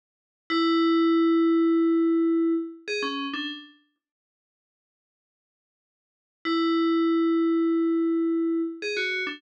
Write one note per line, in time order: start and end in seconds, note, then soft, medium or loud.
0.50 2.53 E4 loud
2.88 3.02 G#4 medium
3.03 3.26 C#4 medium
3.33 3.48 D4 medium
6.45 8.61 E4 medium
8.82 8.96 G#4 medium
8.97 9.23 F#4 medium
9.27 9.41 D4 medium